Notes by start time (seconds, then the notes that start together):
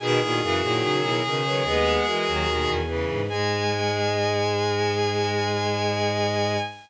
0.00 B2 D#3 G#4 B4 G#5
0.20 A#2 B2 D#3 E4 G#4
0.41 F#2 C#3 E3 F#4 A#4
0.61 A#2 D#3 F#3 E4 G#4
0.81 C#3 D#4 F#4
1.01 B2 E4 G#4
1.23 B2 C#3 D#3
1.44 D#3 F#3 G#4 B4
1.63 D#2 G#3 B3 G#4 B4
2.05 E3 G#3 F#4 A#4
2.27 D#2 D#3 F#3
2.46 D#2 B2 D#3
2.67 E2
2.87 C#3 E3 G#4 B4
3.09 G#2
3.28 G#2 G#3 G#4 G#5